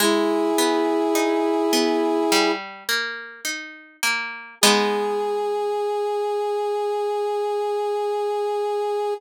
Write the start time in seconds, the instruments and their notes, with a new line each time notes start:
0.00 acoustic guitar (steel) G#3, brass section E4 G#4
0.58 acoustic guitar (steel) B3
1.15 acoustic guitar (steel) D#4
1.73 acoustic guitar (steel) B3
2.32 acoustic guitar (steel) G3
2.89 acoustic guitar (steel) A#3
3.45 acoustic guitar (steel) D#4
4.03 acoustic guitar (steel) A#3
4.61 acoustic guitar (steel) G#3 B3 D#4, brass section G#4